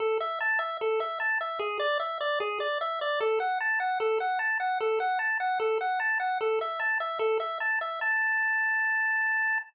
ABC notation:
X:1
M:4/4
L:1/8
Q:1/4=150
K:A
V:1 name="Lead 1 (square)"
A e a e A e a e | G d e d G d e d | A f a f A f a f | A f a f A f a f |
A e a e A e a e | a8 |]